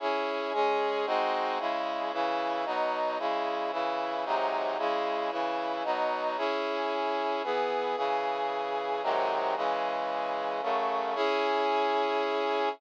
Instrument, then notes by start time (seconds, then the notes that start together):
brass section
0.00 C#4 E4 G#4
0.53 G#3 C#4 G#4
1.06 G#3 C4 D#4 F#4
1.59 C#3 G#3 E4
2.12 C#3 E3 E4
2.65 B2 F#3 D#4
3.19 C#3 G#3 E4
3.72 C#3 E3 E4
4.25 G#2 C3 F#3 D#4
4.78 C#3 G#3 E4
5.31 C#3 E3 E4
5.84 B2 F#3 D#4
6.37 C#4 E4 G#4
7.43 E3 B3 G#4
7.96 C#3 E3 G#4
9.03 G#2 C3 D#3 F#3
9.56 C#3 E3 G#3
10.62 F#2 C#3 A3
11.15 C#4 E4 G#4